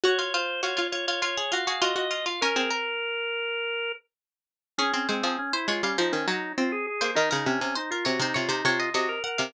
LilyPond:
<<
  \new Staff \with { instrumentName = "Harpsichord" } { \time 4/4 \key des \major \tempo 4 = 101 ges'16 f'16 f'8 f'16 f'16 f'16 f'16 f'16 aes'16 f'16 aes'16 f'8 f'16 f'16 | bes'16 aes'16 bes'2~ bes'8 r4 | aes'8 c''16 aes'8 c''16 des''16 f''16 c''8 des''4~ des''16 c''16 | bes'16 bes'16 r8 c''16 bes'16 des''16 c''16 des''16 c''16 des''16 ees''16 ees''8 ges''16 f''16 | }
  \new Staff \with { instrumentName = "Drawbar Organ" } { \time 4/4 \key des \major des''16 des''16 c''8 des''8 des''16 des''16 des''8 f''8 ees''16 ees''8 f''16 | bes'2. r4 | des'16 des'16 c'16 c'16 des'16 e'16 f'16 des'16 ees'16 des'16 ees'8 f'16 aes'16 aes'8 | ees'16 ees'16 des'16 des'16 ees'16 f'16 ges'16 ees'16 f'16 ees'16 f'8 ges'16 bes'16 bes'8 | }
  \new Staff \with { instrumentName = "Pizzicato Strings" } { \time 4/4 \key des \major ges'8. r16 ges'16 f'8. f'8 ges'16 ges'16 ges'16 ges'8. | des'16 c'2~ c'16 r4. | des'16 c'16 aes16 f16 r8 aes16 g16 f16 ees16 ges8 c'8 r16 bes16 | ees16 des16 c16 c16 r8 c16 c16 c16 c16 c8 c8 r16 c16 | }
>>